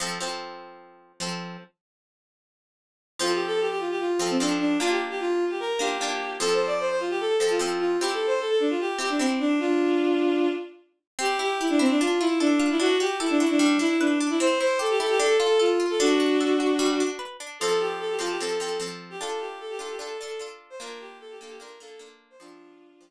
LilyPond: <<
  \new Staff \with { instrumentName = "Violin" } { \time 4/4 \key f \major \tempo 4 = 150 r1 | r1 | \tuplet 3/2 { f'8 g'8 a'8 } g'16 g'16 f'16 g'16 f'8 f'16 c'16 d'8 d'8 | f'16 g'16 r16 g'16 f'8. g'16 bes'8 g'4. |
\tuplet 3/2 { a'8 c''8 d''8 } c''16 c''16 f'16 g'16 a'8 a'16 f'16 f'8 f'8 | \tuplet 3/2 { g'8 a'8 c''8 } a'16 a'16 d'16 f'16 g'8 g'16 d'16 c'8 d'8 | <d' f'>2~ <d' f'>8 r4. | \key c \major g'8 g'8 e'16 d'16 c'16 d'16 f'8 e'8 d'8. e'16 |
fis'8 g'8 e'16 d'16 e'16 d'16 d'8 e'8 d'8. e'16 | c''8 c''8 a'16 g'16 a'16 g'16 a'8 a'8 f'8. a'16 | <d' fis'>2. r4 | \key f \major a'8 g'8 a'16 g'16 f'16 g'16 a'8 a'8 r8. g'16 |
a'8 g'8 a'16 g'16 a'16 g'16 a'8 a'8 r8. c''16 | bes'8 g'8 a'16 g'16 a'16 g'16 bes'8 a'8 r8. c''16 | <d' f'>2~ <d' f'>8 r4. | }
  \new Staff \with { instrumentName = "Pizzicato Strings" } { \time 4/4 \key f \major <f c' a'>8 <f c' a'>2~ <f c' a'>8 <f c' a'>4 | r1 | <f c' a'>2~ <f c' a'>8 <f c' a'>8 <f c' a'>4 | <bes d' f'>2~ <bes d' f'>8 <bes d' f'>8 <bes d' f'>4 |
<f c' a'>2~ <f c' a'>8 <f c' a'>8 <f c' a'>4 | <c' e' g'>2~ <c' e' g'>8 <c' e' g'>8 <c' e' g'>4 | r1 | \key c \major c'8 e'8 g'8 e'8 d'8 f'8 a'8 f'8 |
d'8 fis'8 a'8 fis'8 g8 d'8 b'8 d'8 | c'8 e'8 g'8 e'8 d'8 f'8 a'8 f'8 | d'8 fis'8 a'8 fis'8 g8 d'8 b'8 d'8 | \key f \major <f c' a'>4. <f c' a'>8 <f c' a'>8 <f c' a'>8 <f c' a'>4 |
<d' f' a'>4. <d' f' a'>8 <d' f' a'>8 <d' f' a'>8 <d' f' a'>4 | <bes d' f'>4. <bes d' f'>8 <bes d' f'>8 <bes d' f'>8 <bes d' f'>4 | <f c' a'>4. <f c' a'>8 r2 | }
>>